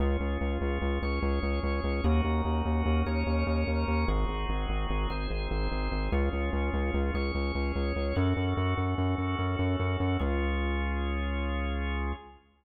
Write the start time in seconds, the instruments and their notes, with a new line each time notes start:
0.00 synth bass 1 C#2, drawbar organ C#4 F4 G#4
0.20 synth bass 1 C#2
0.41 synth bass 1 C#2
0.61 synth bass 1 C#2
0.82 synth bass 1 C#2
1.02 synth bass 1 C#2, drawbar organ C#4 G#4 C#5
1.22 synth bass 1 C#2
1.43 synth bass 1 C#2
1.63 synth bass 1 C#2
1.84 synth bass 1 C#2
2.04 synth bass 1 D#2, drawbar organ C#4 D#4 F#4 A#4
2.24 synth bass 1 D#2
2.45 synth bass 1 D#2
2.65 synth bass 1 D#2
2.86 synth bass 1 D#2
3.06 synth bass 1 D#2, drawbar organ C#4 D#4 A#4 C#5
3.26 synth bass 1 D#2
3.47 synth bass 1 D#2
3.67 synth bass 1 D#2
3.88 synth bass 1 D#2
4.08 synth bass 1 G#1, drawbar organ C4 D#4 F#4 G#4
4.28 synth bass 1 G#1
4.49 synth bass 1 G#1
4.69 synth bass 1 G#1
4.90 synth bass 1 G#1
5.10 synth bass 1 G#1, drawbar organ C4 D#4 G#4 C5
5.30 synth bass 1 G#1
5.51 synth bass 1 G#1
5.72 synth bass 1 G#1
5.92 synth bass 1 G#1
6.12 synth bass 1 C#2, drawbar organ C#4 F4 G#4
6.33 synth bass 1 C#2
6.53 synth bass 1 C#2
6.73 synth bass 1 C#2
6.94 synth bass 1 C#2
7.14 synth bass 1 C#2, drawbar organ C#4 G#4 C#5
7.35 synth bass 1 C#2
7.55 synth bass 1 C#2
7.76 synth bass 1 C#2
7.96 synth bass 1 C#2
8.16 synth bass 1 F#2, drawbar organ C#4 F#4 A4
8.37 synth bass 1 F#2
8.57 synth bass 1 F#2
8.77 synth bass 1 F#2
8.98 synth bass 1 F#2
9.18 synth bass 1 F#2
9.39 synth bass 1 F#2
9.59 synth bass 1 F#2
9.80 synth bass 1 F#2
10.00 synth bass 1 F#2
10.19 synth bass 1 C#2, drawbar organ C#4 F4 G#4